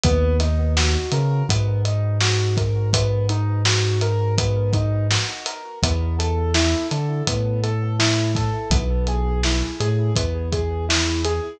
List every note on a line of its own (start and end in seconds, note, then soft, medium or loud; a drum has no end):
0.04 0.97 D#2 loud
0.04 0.37 B3 loud
0.04 kick loud
0.04 closed hi-hat loud
0.40 0.73 D#4 medium
0.40 snare soft
0.40 closed hi-hat medium
0.77 1.09 F#4 medium
0.77 snare loud
1.12 1.43 C#3 loud
1.12 1.45 A#4 medium
1.12 closed hi-hat medium
1.49 5.18 G#2 loud
1.49 1.81 B3 medium
1.49 kick medium
1.49 closed hi-hat loud
1.85 2.17 D#4 medium
1.85 closed hi-hat medium
2.21 2.54 F#4 medium
2.21 snare loud
2.57 2.90 A#4 medium
2.57 kick medium
2.57 closed hi-hat medium
2.93 3.26 B3 medium
2.93 kick medium
2.93 closed hi-hat loud
3.29 3.62 D#4 medium
3.29 closed hi-hat medium
3.65 3.98 F#4 medium
3.65 snare loud
4.01 4.35 A#4 medium
4.01 closed hi-hat medium
4.38 4.70 B3 medium
4.38 kick medium
4.38 closed hi-hat loud
4.73 5.07 D#4 medium
4.73 kick medium
4.73 closed hi-hat medium
5.11 5.43 F#4 medium
5.11 snare loud
5.46 5.79 A#4 medium
5.46 closed hi-hat medium
5.83 6.75 E2 loud
5.83 6.15 B3 medium
5.83 kick medium
5.83 closed hi-hat loud
6.19 6.51 A4 medium
6.19 closed hi-hat medium
6.54 6.87 E4 medium
6.54 snare loud
6.91 7.22 D3 medium
6.91 7.24 A4 medium
6.91 closed hi-hat medium
7.27 8.50 A2 medium
7.27 7.60 B3 medium
7.27 kick medium
7.27 closed hi-hat loud
7.63 7.96 A4 medium
7.63 closed hi-hat medium
7.99 8.32 E4 medium
7.99 snare loud
8.35 8.69 A4 medium
8.35 kick medium
8.35 snare soft
8.35 closed hi-hat medium
8.70 9.63 B1 loud
8.70 9.05 B3 medium
8.70 kick loud
8.70 closed hi-hat loud
9.07 9.41 G#4 medium
9.07 closed hi-hat medium
9.43 9.77 E4 medium
9.43 snare medium
9.80 10.11 A2 loud
9.80 10.13 G#4 medium
9.80 closed hi-hat medium
10.16 11.40 E2 medium
10.16 10.49 B3 medium
10.16 kick medium
10.16 closed hi-hat medium
10.52 10.85 G#4 medium
10.52 kick medium
10.52 closed hi-hat medium
10.89 11.21 E4 medium
10.89 snare loud
11.25 11.58 G#4 medium
11.25 closed hi-hat medium